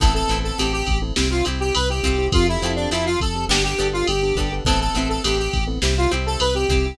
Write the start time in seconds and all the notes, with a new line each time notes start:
0.00 A1 B3 C4 E4 A4, kick, ride
0.14 B3 C4 E4 A4
0.28 A1 B3 C4 E4, ride
0.32 A4
0.44 A4
0.58 A1 B3 C4 E4 G4 A4, ride
0.73 G4
0.87 A1, kick, ride
1.02 B3 C4 E4 A4
1.16 C2 C4 E4 G4, snare
1.30 C4 E4 F4 G4
1.45 C2 C4 E4 G4, ride
1.60 G4
1.75 C2 B4, ride
1.90 C4 E4 G4
2.03 C2 C4 E4 F4 G4 A4, kick, ride
2.18 C4 E4 G4
2.32 F2 C4 F4 G4 A4, kick, ride
2.47 C4 E4 F4 G4 A4
2.62 F2 C4 F4 G4 A4, ride
2.76 D4
2.91 F2 C4 E4 F4 G4 A4, ride
3.06 F4
3.20 F2 A4, kick, ride
3.35 C4 F4 G4 A4
3.49 G1 B3 D4 G4 A4, snare
3.64 B3 D4 G4 A4
3.78 G1 B3 D4 G4 A4, ride
3.93 F4
4.07 G1 G4, ride
4.23 B3 D4 G4 A4
4.35 G1 B3 D4 G4 A4, kick, ride
4.40 A4
4.52 B3 D4 G4 A4
4.65 A1 B3 C4 E4 A4, kick, ride
4.69 A4
4.80 B3 C4 E4 A4
4.94 A1 B3 C4 E4, ride
4.98 A4
5.09 A4
5.24 A1 B3 C4 E4 G4 A4, ride
5.39 G4
5.53 A1, kick, ride
5.67 B3 C4 E4 A4
5.82 C2 C4 E4 G4, snare
5.97 C4 E4 F4 G4
6.11 C2 C4 E4 G4, ride
6.26 A4
6.40 C2 B4, ride
6.55 C4 E4 G4
6.69 C2 C4 E4 G4, kick, ride
6.86 C4 E4 G4